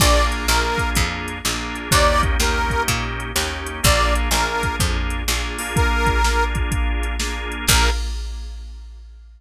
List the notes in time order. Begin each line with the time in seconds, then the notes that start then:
0.00 A#1 A#3 D4 F4 G#4 D5, kick, crash
0.32 closed hi-hat
0.48 A#1 A#3 D4 F4 G#4 A#4, snare
0.78 kick, closed hi-hat
0.95 F2, kick, closed hi-hat
1.28 closed hi-hat
1.45 A#1 A#3 D4 F4 G#4, snare
1.76 closed hi-hat
1.91 D#2 A#3 C#4 D#4 G4 D5, kick, closed hi-hat
2.23 kick, closed hi-hat
2.40 D#2 A#3 C#4 D#4 G4 A#4, snare
2.70 kick, closed hi-hat
2.88 A#2, kick, closed hi-hat
3.20 closed hi-hat
3.35 D#2 A#3 C#4 D#4 G4, snare
3.67 closed hi-hat
3.83 A#1 A#3 D4 F4 G#4 D5, kick, closed hi-hat
4.16 closed hi-hat
4.31 A#1 A#3 D4 F4 G#4 A#4, snare
4.63 kick, closed hi-hat
4.80 F2, kick, closed hi-hat
5.10 closed hi-hat
5.28 A#1 A#3 D4 F4 G#4, snare
5.58 A#3 D4 F4 G#4, open hi-hat
5.76 A#4, kick, closed hi-hat
6.07 kick, closed hi-hat
6.24 A#3 D4 F4 G#4, snare
6.55 kick, closed hi-hat
6.71 kick, closed hi-hat
7.03 closed hi-hat
7.20 A#3 D4 F4 G#4, snare
7.52 closed hi-hat
7.67 A#1 A#3 D4 F4 G#4 A#4, kick, crash